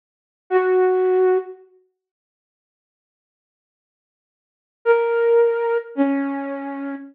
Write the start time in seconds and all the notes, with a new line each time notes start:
0.50 F#4
4.85 A#4
5.95 C#4